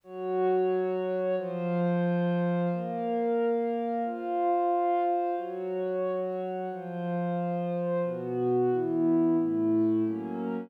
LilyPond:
\new Staff { \time 4/4 \key bes \minor \tempo 4 = 180 <ges ges' des''>1 | <f f' c''>1 | <bes bes' f''>1 | <f' c'' f''>1 |
<ges ges' des''>1 | <f f' c''>1 | \key b \minor <b, b fis'>2 <e b e'>2 | <a, a e'>2 <fis ais cis'>2 | }